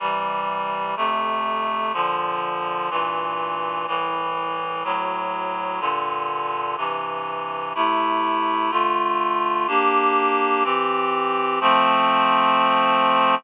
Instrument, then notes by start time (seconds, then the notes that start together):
clarinet
0.00 C3 E3 G3
0.97 F2 C3 A3
1.94 A#2 D3 F3
2.90 G2 A#2 E3
3.87 C2 A2 E3
4.84 D2 A2 F#3
5.80 G2 A#2 D3
6.77 G2 C3 E3
7.75 C3 A3 E4
8.71 D3 A3 F4
9.68 A#3 D4 G4
10.64 E3 C4 G4
11.61 F3 A3 C4